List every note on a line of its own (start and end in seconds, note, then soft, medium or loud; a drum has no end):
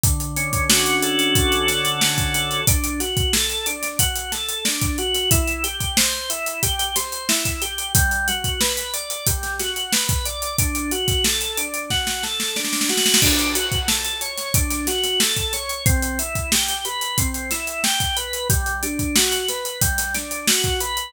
0.04 1.35 D3 loud
0.04 kick loud
0.04 closed hi-hat loud
0.20 closed hi-hat medium
0.37 1.68 C#4 loud
0.37 closed hi-hat medium
0.53 kick loud
0.53 closed hi-hat medium
0.69 2.01 F#4 medium
0.69 snare loud
0.86 closed hi-hat medium
1.02 2.34 A4 medium
1.02 closed hi-hat medium
1.19 closed hi-hat medium
1.35 2.61 D3 medium
1.35 kick loud
1.35 closed hi-hat loud
1.52 closed hi-hat medium
1.68 2.63 C#4 medium
1.68 snare medium
1.68 closed hi-hat medium
1.85 closed hi-hat medium
2.01 2.64 F#4 medium
2.01 snare loud
2.18 kick medium
2.18 closed hi-hat medium
2.34 2.66 A4 medium
2.34 snare soft
2.34 closed hi-hat medium
2.51 closed hi-hat medium
2.67 3.00 D4 loud
2.67 kick loud
2.67 closed hi-hat loud
2.84 closed hi-hat medium
3.00 3.33 F#4 medium
3.00 snare soft
3.00 closed hi-hat medium
3.17 kick loud
3.17 closed hi-hat medium
3.33 3.66 A4 medium
3.33 snare loud
3.50 closed hi-hat medium
3.66 3.99 D4 medium
3.66 closed hi-hat medium
3.83 snare soft
3.83 closed hi-hat medium
3.99 4.32 F#4 medium
3.99 kick medium
3.99 closed hi-hat loud
4.16 closed hi-hat medium
4.32 4.65 A4 medium
4.32 snare medium
4.32 closed hi-hat medium
4.49 closed hi-hat medium
4.65 4.98 D4 medium
4.65 snare loud
4.81 kick loud
4.81 closed hi-hat medium
4.98 5.30 F#4 medium
4.98 closed hi-hat medium
5.15 snare soft
5.15 closed hi-hat medium
5.31 5.64 E4 loud
5.31 kick loud
5.31 closed hi-hat loud
5.48 closed hi-hat medium
5.64 5.97 G4 medium
5.64 closed hi-hat medium
5.80 kick medium
5.80 closed hi-hat medium
5.97 6.30 C5 loud
5.97 snare loud
6.30 6.63 E4 medium
6.30 closed hi-hat medium
6.46 closed hi-hat medium
6.63 6.96 G4 loud
6.63 kick medium
6.63 closed hi-hat loud
6.79 closed hi-hat medium
6.96 7.29 C5 medium
6.96 snare medium
6.96 closed hi-hat loud
7.12 closed hi-hat medium
7.29 7.62 E4 medium
7.29 snare loud
7.45 kick medium
7.45 closed hi-hat medium
7.62 7.93 G4 medium
7.62 closed hi-hat medium
7.78 closed hi-hat medium
7.95 8.28 G3 loud
7.95 kick loud
7.95 closed hi-hat loud
8.11 closed hi-hat medium
8.28 8.61 F#4 medium
8.28 closed hi-hat medium
8.44 kick medium
8.44 closed hi-hat medium
8.61 8.94 B4 medium
8.61 snare loud
8.77 closed hi-hat medium
8.94 9.27 D5 medium
8.94 closed hi-hat medium
9.10 closed hi-hat medium
9.27 9.60 G3 medium
9.27 kick loud
9.27 closed hi-hat loud
9.43 snare soft
9.43 closed hi-hat medium
9.60 9.93 F#4 medium
9.60 snare medium
9.60 closed hi-hat medium
9.76 closed hi-hat medium
9.93 10.26 B4 medium
9.93 snare loud
10.09 kick loud
10.09 closed hi-hat medium
10.26 10.57 D5 medium
10.26 closed hi-hat medium
10.42 closed hi-hat medium
10.59 10.92 D4 loud
10.59 kick loud
10.59 closed hi-hat loud
10.75 closed hi-hat medium
10.91 11.24 F#4 medium
10.91 closed hi-hat medium
11.08 kick loud
11.08 snare soft
11.08 closed hi-hat medium
11.24 11.58 A4 medium
11.24 snare loud
11.41 closed hi-hat medium
11.57 11.91 D4 medium
11.57 closed hi-hat medium
11.74 closed hi-hat medium
11.90 12.23 F#4 loud
11.90 kick medium
11.90 snare medium
12.07 snare medium
12.23 12.56 A4 medium
12.23 snare medium
12.40 snare medium
12.56 12.89 D4 medium
12.56 snare medium
12.65 snare medium
12.73 snare medium
12.81 snare loud
12.89 13.21 F#4 medium
12.89 snare medium
12.97 snare loud
13.06 snare loud
13.14 snare loud
13.22 13.55 D4 loud
13.22 kick loud
13.22 crash loud
13.39 closed hi-hat medium
13.55 13.88 F#4 medium
13.55 closed hi-hat loud
13.72 kick medium
13.72 closed hi-hat medium
13.88 14.21 A4 loud
13.88 snare loud
14.05 closed hi-hat medium
14.21 14.54 C#5 medium
14.21 closed hi-hat medium
14.38 snare soft
14.38 closed hi-hat medium
14.54 14.87 D4 loud
14.54 kick loud
14.54 closed hi-hat loud
14.71 snare soft
14.71 closed hi-hat medium
14.87 15.20 F#4 medium
14.87 snare medium
14.87 closed hi-hat medium
15.04 snare soft
15.04 closed hi-hat medium
15.20 15.53 A4 medium
15.20 snare loud
15.37 kick medium
15.37 closed hi-hat medium
15.53 15.85 C#5 medium
15.53 snare soft
15.53 closed hi-hat medium
15.69 closed hi-hat medium
15.86 16.19 C4 loud
15.86 kick loud
15.86 closed hi-hat loud
16.02 closed hi-hat medium
16.19 16.52 E4 medium
16.19 closed hi-hat medium
16.35 kick medium
16.35 closed hi-hat medium
16.52 16.85 G4 medium
16.52 snare loud
16.68 closed hi-hat medium
16.85 17.18 B4 medium
16.85 closed hi-hat medium
17.01 closed hi-hat medium
17.18 17.51 C4 medium
17.18 kick loud
17.18 closed hi-hat loud
17.34 closed hi-hat medium
17.51 17.84 E4 medium
17.51 snare medium
17.51 closed hi-hat medium
17.67 closed hi-hat medium
17.84 18.17 G4 medium
17.84 snare loud
18.00 kick medium
18.00 closed hi-hat medium
18.16 18.48 B4 medium
18.16 closed hi-hat medium
18.33 closed hi-hat medium
18.50 18.83 G3 loud
18.50 kick loud
18.50 closed hi-hat loud
18.66 closed hi-hat medium
18.83 19.16 D4 medium
18.83 closed hi-hat medium
18.99 kick medium
18.99 closed hi-hat medium
19.16 19.49 F#4 medium
19.16 snare loud
19.32 closed hi-hat medium
19.48 19.82 B4 medium
19.48 snare soft
19.48 closed hi-hat medium
19.65 closed hi-hat medium
19.81 20.14 G3 loud
19.81 kick loud
19.81 closed hi-hat loud
19.98 snare soft
19.98 closed hi-hat loud
20.14 20.47 D4 medium
20.14 snare medium
20.14 closed hi-hat medium
20.31 closed hi-hat medium
20.48 20.81 F#4 medium
20.48 snare loud
20.64 kick medium
20.64 closed hi-hat medium
20.80 21.12 B4 loud
20.80 closed hi-hat medium
20.97 closed hi-hat medium